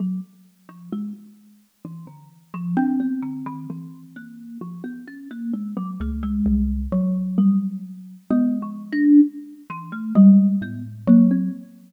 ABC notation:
X:1
M:5/8
L:1/16
Q:1/4=65
K:none
V:1 name="Kalimba"
_G, z2 F, _A, z3 E, D, | z F, D B, D, _E, =E,2 _B,2 | F, B, _D _B, _A, _G, =A, _A,3 | z2 G,2 z2 (3B,2 F,2 D2 |
z2 E, A, G,2 B, z _B, C |]
V:2 name="Xylophone"
z10 | z2 C8 | z6 _D,,2 C,,2 | _G,6 _A,4 |
z4 _A,2 =A,,2 _G,2 |]